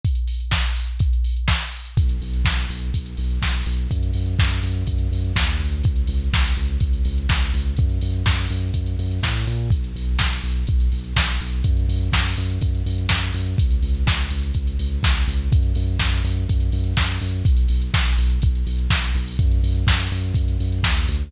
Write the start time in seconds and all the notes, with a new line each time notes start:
0.05 kick, closed hi-hat
0.15 closed hi-hat
0.28 open hi-hat
0.40 closed hi-hat
0.51 kick, snare
0.64 closed hi-hat
0.76 open hi-hat
0.87 closed hi-hat
0.99 kick, closed hi-hat
1.13 closed hi-hat
1.24 open hi-hat
1.36 closed hi-hat
1.48 kick, snare
1.62 closed hi-hat
1.72 open hi-hat
1.85 closed hi-hat
1.97 B1, kick, closed hi-hat
2.09 closed hi-hat
2.21 B1, open hi-hat
2.34 closed hi-hat
2.45 B1, kick, snare
2.57 closed hi-hat
2.70 B1, open hi-hat
2.81 closed hi-hat
2.94 B1, kick, closed hi-hat
3.06 closed hi-hat
3.17 B1, open hi-hat
3.30 closed hi-hat
3.42 B1, kick, snare
3.55 closed hi-hat
3.66 B1, open hi-hat
3.78 closed hi-hat
3.90 F#2, kick, closed hi-hat
4.03 closed hi-hat
4.14 F#2, open hi-hat
4.26 closed hi-hat
4.39 F#2, kick, snare
4.51 closed hi-hat
4.63 F#2, open hi-hat
4.75 closed hi-hat
4.87 F#2, kick, closed hi-hat
4.98 closed hi-hat
5.11 F#2, open hi-hat
5.25 closed hi-hat
5.36 D#2, kick, snare
5.47 closed hi-hat
5.60 D2, open hi-hat
5.72 closed hi-hat
5.84 C#2, kick, closed hi-hat
5.96 closed hi-hat
6.07 C#2, open hi-hat
6.20 closed hi-hat
6.33 C#2, kick, snare
6.45 closed hi-hat
6.57 C#2, open hi-hat
6.69 closed hi-hat
6.80 C#2, kick, closed hi-hat
6.93 closed hi-hat
7.05 C#2, open hi-hat
7.18 closed hi-hat
7.29 C#2, kick, snare
7.40 closed hi-hat
7.54 C#2, open hi-hat
7.66 closed hi-hat
7.77 F#2, kick, closed hi-hat
7.90 closed hi-hat
8.01 F#2, open hi-hat
8.13 closed hi-hat
8.26 F#2, kick, snare
8.39 closed hi-hat
8.50 F#2, open hi-hat
8.62 closed hi-hat
8.74 F#2, kick, closed hi-hat
8.86 closed hi-hat
8.99 F#2, open hi-hat
9.11 closed hi-hat
9.23 A2, kick, snare
9.35 closed hi-hat
9.47 A#2, open hi-hat
9.59 closed hi-hat
9.70 B1, kick, closed hi-hat
9.84 closed hi-hat
9.96 B1, open hi-hat
10.08 closed hi-hat
10.19 B1, kick, snare
10.32 closed hi-hat
10.43 B1, open hi-hat
10.55 closed hi-hat
10.67 B1, kick, closed hi-hat
10.80 closed hi-hat
10.92 B1, open hi-hat
11.04 closed hi-hat
11.16 B1, kick, snare
11.28 closed hi-hat
11.40 B1, open hi-hat
11.52 closed hi-hat
11.64 F#2, kick, closed hi-hat
11.77 closed hi-hat
11.89 F#2, open hi-hat
12.01 closed hi-hat
12.13 F#2, kick, snare
12.25 closed hi-hat
12.37 F#2, open hi-hat
12.50 closed hi-hat
12.61 F#2, kick, closed hi-hat
12.75 closed hi-hat
12.86 F#2, open hi-hat
12.98 closed hi-hat
13.09 F#2, kick, snare
13.21 closed hi-hat
13.34 F#2, open hi-hat
13.46 closed hi-hat
13.58 C#2, kick, closed hi-hat
13.71 closed hi-hat
13.83 C#2, open hi-hat
13.95 closed hi-hat
14.07 C#2, kick, snare
14.19 closed hi-hat
14.31 C#2, open hi-hat
14.43 closed hi-hat
14.54 C#2, kick, closed hi-hat
14.67 closed hi-hat
14.79 C#2, open hi-hat
14.92 closed hi-hat
15.03 C#2, kick, snare
15.16 closed hi-hat
15.28 C#2, open hi-hat
15.39 closed hi-hat
15.52 F#2, kick, closed hi-hat
15.63 closed hi-hat
15.75 F#2, open hi-hat
15.88 closed hi-hat
15.99 F#2, kick, snare
16.13 closed hi-hat
16.24 F#2, open hi-hat
16.36 closed hi-hat
16.49 F#2, kick, closed hi-hat
16.60 closed hi-hat
16.72 F#2, open hi-hat
16.84 closed hi-hat
16.97 F#2, kick, snare
17.09 closed hi-hat
17.21 F#2, open hi-hat
17.33 closed hi-hat
17.45 B1, kick, closed hi-hat
17.57 closed hi-hat
17.68 B1, open hi-hat
17.82 closed hi-hat
17.94 B1, kick, snare
18.06 closed hi-hat
18.18 B1, open hi-hat
18.30 closed hi-hat
18.42 B1, kick, closed hi-hat
18.55 closed hi-hat
18.67 B1, open hi-hat
18.79 closed hi-hat
18.90 B1, kick, snare
19.03 closed hi-hat
19.14 B1, open hi-hat
19.28 open hi-hat
19.39 F#2, kick, closed hi-hat
19.52 closed hi-hat
19.63 F#2, open hi-hat
19.75 closed hi-hat
19.87 F#2, kick, snare
19.99 closed hi-hat
20.12 F#2, open hi-hat
20.24 closed hi-hat
20.34 F#2, kick, closed hi-hat
20.48 closed hi-hat
20.60 F#2, open hi-hat
20.72 closed hi-hat
20.83 D#2, kick, snare
20.96 closed hi-hat
21.08 D2, open hi-hat
21.20 closed hi-hat